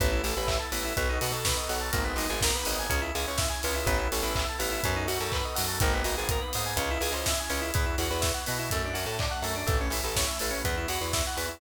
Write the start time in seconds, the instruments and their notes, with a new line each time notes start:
0.00 electric bass (finger) A1, electric piano 2 B3, pad 5 (bowed) B3 E4 A4, kick, closed hi-hat
0.12 electric piano 2 E4
0.24 electric bass (finger) A1, electric piano 2 A4, open hi-hat
0.37 electric bass (finger) A1, electric piano 2 B4
0.47 electric piano 2 E5, kick, clap
0.59 electric piano 2 A5
0.72 electric bass (finger) A1, electric piano 2 B3, open hi-hat
0.84 electric piano 2 E4
0.97 electric bass (finger) B1, electric piano 2 B3, pad 5 (bowed) B3 D#4 F#4 A4, kick, closed hi-hat
1.09 electric piano 2 D#4
1.21 electric bass (finger) B2, electric piano 2 F#4, open hi-hat
1.32 electric bass (finger) B2, electric piano 2 A4
1.45 electric piano 2 B4, kick, snare
1.57 electric piano 2 D#5
1.69 electric bass (finger) B1, electric piano 2 F#5, open hi-hat
1.80 electric piano 2 A5
1.92 electric bass (finger) G#1, electric piano 2 A#3, pad 5 (bowed) A#3 B3 D#4 G#4, kick, closed hi-hat
2.04 electric piano 2 B3
2.16 electric bass (finger) G#1, electric piano 2 D#4, open hi-hat
2.29 electric bass (finger) G#1, electric piano 2 G#4
2.41 electric piano 2 A#4, kick, snare
2.55 electric piano 2 B4
2.65 electric bass (finger) G#1, electric piano 2 D#5, open hi-hat
2.79 electric piano 2 G#5
2.90 electric bass (finger) C#2, electric piano 2 C#4, pad 5 (bowed) C#4 E4 G#4, kick, closed hi-hat
3.02 electric piano 2 E4
3.15 electric bass (finger) C#2, electric piano 2 G#4, open hi-hat
3.27 electric bass (finger) C#2, electric piano 2 C#5
3.38 electric piano 2 E5, kick, snare
3.50 electric piano 2 G#5
3.63 electric bass (finger) C#2, electric piano 2 C#4, open hi-hat
3.74 electric piano 2 E4
3.86 electric bass (finger) A1, pad 5 (bowed) B3 E4 A4, electric piano 2 B3, kick, closed hi-hat
3.98 electric piano 2 E4
4.12 electric bass (finger) A1, electric piano 2 A4, open hi-hat
4.22 electric bass (finger) A1, electric piano 2 B4
4.35 electric piano 2 E5, kick, clap
4.49 electric piano 2 A5
4.59 electric bass (finger) A1, electric piano 2 B3, open hi-hat
4.71 electric piano 2 E4
4.83 electric bass (finger) F#2, electric piano 2 B3, pad 5 (bowed) B3 D#4 F#4 A4, kick, closed hi-hat
4.96 electric piano 2 D#4
5.08 electric bass (finger) F#2, electric piano 2 F#4, open hi-hat
5.20 electric bass (finger) F#2, electric piano 2 A4
5.32 electric piano 2 B4, kick, clap
5.45 electric piano 2 D#5
5.55 electric bass (finger) F#2, electric piano 2 F#5, open hi-hat
5.67 electric piano 2 A5
5.80 electric bass (finger) G#1, pad 5 (bowed) A#3 B3 D#4 G#4, electric piano 2 A#3, kick, closed hi-hat
5.94 electric piano 2 B3
6.04 electric bass (finger) G#1, electric piano 2 D#4, open hi-hat
6.17 electric bass (finger) G#1, electric piano 2 G#4
6.29 electric piano 2 A#4, kick, closed hi-hat
6.41 electric piano 2 B4
6.53 electric bass (finger) G#2, electric piano 2 D#5, open hi-hat
6.66 electric piano 2 G#5
6.77 electric bass (finger) C#2, pad 5 (bowed) C#4 E4 G#4, electric piano 2 C#4, kick, closed hi-hat
6.91 electric piano 2 E4
7.01 electric bass (finger) C#2, electric piano 2 G#4, open hi-hat
7.12 electric bass (finger) C#2, electric piano 2 C5
7.26 electric piano 2 E5, kick, snare
7.40 electric piano 2 G#5
7.49 electric bass (finger) C#2, electric piano 2 C#4, open hi-hat
7.61 electric piano 2 E4
7.74 electric bass (finger) E2, electric piano 2 B3, pad 5 (bowed) B3 E4 F#4, kick, closed hi-hat
7.86 electric piano 2 E4
7.98 electric bass (finger) E2, electric piano 2 F#4, open hi-hat
8.11 electric bass (finger) E2, electric piano 2 B4
8.21 electric piano 2 E5, kick, snare
8.34 electric piano 2 F#5
8.46 electric bass (finger) B2, electric piano 2 B3, open hi-hat
8.59 electric piano 2 E4
8.70 electric bass (finger) F#2, pad 5 (bowed) A3 D4 F#4, electric piano 2 A3, kick, closed hi-hat
8.85 electric piano 2 D4
8.93 electric bass (finger) F#2, electric piano 2 F#4, open hi-hat
9.06 electric bass (finger) A2, electric piano 2 A4
9.19 electric piano 2 D5, kick, clap
9.31 electric piano 2 F#5
9.42 electric bass (finger) F#2, electric piano 2 A3, open hi-hat
9.56 electric piano 2 D4
9.67 electric bass (finger) A1, electric piano 2 A3, pad 5 (bowed) A3 C#4 E4, kick, closed hi-hat
9.81 electric piano 2 C#4
9.90 electric bass (finger) A1, electric piano 2 E4, open hi-hat
10.04 electric bass (finger) A1, electric piano 2 A4
10.16 electric piano 2 C#5, kick, snare
10.27 electric piano 2 E5
10.39 electric bass (finger) A1, electric piano 2 A3, open hi-hat
10.50 electric piano 2 C#4
10.64 electric bass (finger) E2, electric piano 2 B3, pad 5 (bowed) B3 E4 F#4, kick, closed hi-hat
10.77 electric piano 2 E4
10.88 electric bass (finger) E2, electric piano 2 F#4, open hi-hat
11.01 electric bass (finger) E2, electric piano 2 B4
11.13 electric piano 2 E5, kick, snare
11.27 electric piano 2 F#5
11.37 electric bass (finger) E2, electric piano 2 B3, open hi-hat
11.49 electric piano 2 E4